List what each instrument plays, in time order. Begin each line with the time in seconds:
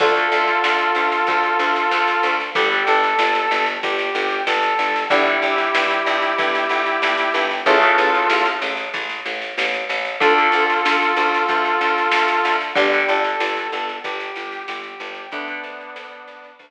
0.00 electric bass (finger) D2, acoustic guitar (steel) D3 A3, brass section F4 A4, kick, snare, crash
0.16 snare
0.32 electric bass (finger) D2, snare
0.48 snare
0.64 electric bass (finger) D2, snare
0.79 snare
0.95 electric bass (finger) D2, snare
1.12 snare
1.27 electric bass (finger) D2, kick, snare
1.43 snare
1.59 electric bass (finger) D2, snare
1.76 snare
1.91 electric bass (finger) D2, snare
2.08 snare
2.23 electric bass (finger) D2, snare
2.40 snare
2.55 electric bass (finger) G1, acoustic guitar (steel) D3 G3, brass section G4, kick, snare
2.72 snare
2.87 electric bass (finger) G1, brass section A4, snare
3.03 snare
3.19 electric bass (finger) G1, snare
3.35 snare
3.51 electric bass (finger) G1, snare
3.66 snare
3.83 electric bass (finger) G1, brass section G4, kick, snare
3.99 snare
4.15 electric bass (finger) G1, snare
4.30 snare
4.47 electric bass (finger) G1, brass section A4, snare
4.63 snare
4.79 electric bass (finger) G1, snare
4.96 snare
5.10 electric bass (finger) G1, acoustic guitar (steel) D3 G3, brass section E4 G4, kick, snare
5.26 snare
5.42 electric bass (finger) G1, snare
5.58 snare
5.74 electric bass (finger) G1, snare
5.90 snare
6.06 electric bass (finger) G1, snare
6.22 snare
6.38 electric bass (finger) G1, kick, snare
6.55 snare
6.69 electric bass (finger) G1, snare
6.86 snare
7.02 electric bass (finger) G1, snare
7.18 snare
7.34 electric bass (finger) G1, snare
7.51 snare
7.66 electric bass (finger) A1, acoustic guitar (steel) C#3 E3 A3, brass section F4 A4, kick, snare
7.82 snare
7.98 electric bass (finger) A1, snare
8.14 snare
8.30 electric bass (finger) A1, snare
8.45 snare
8.62 electric bass (finger) A1, snare
8.77 snare
8.94 electric bass (finger) A1, kick, snare
9.09 snare
9.26 electric bass (finger) A1, snare
9.42 snare
9.58 electric bass (finger) A1, snare
9.74 snare
9.89 electric bass (finger) A1, snare
10.05 snare
10.20 electric bass (finger) D2, acoustic guitar (steel) D3 A3, brass section F4 A4, kick, snare
10.38 snare
10.52 electric bass (finger) D2, snare
10.70 snare
10.85 electric bass (finger) D2, snare
11.02 snare
11.16 electric bass (finger) D2, snare
11.34 snare
11.48 electric bass (finger) D2, kick, snare
11.65 snare
11.81 electric bass (finger) D2, snare
11.98 snare
12.12 electric bass (finger) D2, snare
12.28 snare
12.45 electric bass (finger) D2, snare
12.61 snare
12.75 electric bass (finger) G1, acoustic guitar (steel) D3 G3, brass section G4, kick, snare
12.93 snare
13.09 electric bass (finger) G1, brass section A4, snare
13.24 snare
13.40 electric bass (finger) G1, snare
13.57 snare
13.72 electric bass (finger) G1, snare
13.89 snare
14.04 electric bass (finger) G1, brass section G4, kick, snare
14.20 snare
14.36 electric bass (finger) G1, snare
14.52 snare
14.68 electric bass (finger) G1, brass section G4, snare
14.84 snare
15.00 electric bass (finger) G1, snare
15.15 snare
15.32 electric bass (finger) D2, acoustic guitar (steel) D3 A3, brass section B3 D4, kick, snare
15.48 snare
15.64 electric bass (finger) D2, snare
15.81 snare
15.96 electric bass (finger) D2, snare
16.12 snare
16.28 electric bass (finger) D2, snare
16.44 snare
16.59 electric bass (finger) D2, kick, snare